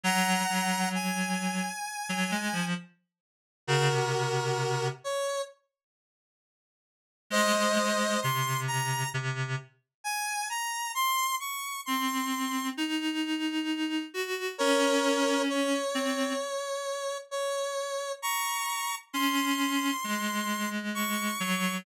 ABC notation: X:1
M:4/4
L:1/16
Q:1/4=66
K:Abmix
V:1 name="Lead 1 (square)"
[gb]4 a8 z4 | [GB]6 d2 z8 | [ce]4 c'2 b2 z4 a2 b2 | c'2 d'2 c'4 z8 |
[Bd]4 d8 d4 | [bd']4 c'8 d'4 |]
V:2 name="Clarinet"
G,2 G,6 z G, A, F, z4 | D, C,5 z10 | A, A, A,2 C,4 C,2 z6 | z4 C4 E6 G2 |
D6 C2 z8 | z4 D4 A,6 G,2 |]